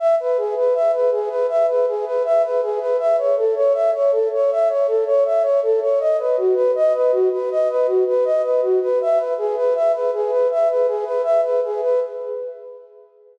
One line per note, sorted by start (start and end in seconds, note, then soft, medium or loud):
0.00 0.15 E5 medium
0.20 0.37 B4 medium
0.38 0.55 G#4 medium
0.57 0.74 B4 medium
0.74 0.92 E5 medium
0.93 1.10 B4 medium
1.12 1.29 G#4 medium
1.29 1.47 B4 medium
1.49 1.66 E5 medium
1.69 1.86 B4 medium
1.88 2.05 G#4 medium
2.05 2.23 B4 medium
2.25 2.42 E5 medium
2.44 2.61 B4 medium
2.62 2.79 G#4 medium
2.80 2.97 B4 medium
2.99 3.16 E5 medium
3.18 3.35 C#5 medium
3.37 3.54 A4 medium
3.56 3.73 C#5 medium
3.74 3.91 E5 medium
3.94 4.11 C#5 medium
4.11 4.28 A4 medium
4.33 4.50 C#5 medium
4.51 4.68 E5 medium
4.70 4.87 C#5 medium
4.87 5.04 A4 medium
5.07 5.24 C#5 medium
5.25 5.43 E5 medium
5.43 5.60 C#5 medium
5.62 5.80 A4 medium
5.82 5.99 C#5 medium
6.00 6.17 D#5 medium
6.19 6.36 B4 medium
6.37 6.55 F#4 medium
6.54 6.72 B4 medium
6.75 6.93 D#5 medium
6.95 7.12 B4 medium
7.12 7.29 F#4 medium
7.32 7.49 B4 medium
7.51 7.68 D#5 medium
7.70 7.87 B4 medium
7.87 8.04 F#4 medium
8.07 8.24 B4 medium
8.25 8.42 D#5 medium
8.44 8.61 B4 medium
8.62 8.80 F#4 medium
8.82 8.99 B4 medium
9.02 9.19 E5 medium
9.17 9.34 B4 medium
9.38 9.55 G#4 medium
9.57 9.74 B4 medium
9.75 9.92 E5 medium
9.93 10.11 B4 medium
10.14 10.31 G#4 medium
10.30 10.48 B4 medium
10.51 10.68 E5 medium
10.70 10.87 B4 medium
10.87 11.04 G#4 medium
11.05 11.22 B4 medium
11.24 11.41 E5 medium
11.43 11.60 B4 medium
11.64 11.81 G#4 medium
11.82 12.00 B4 medium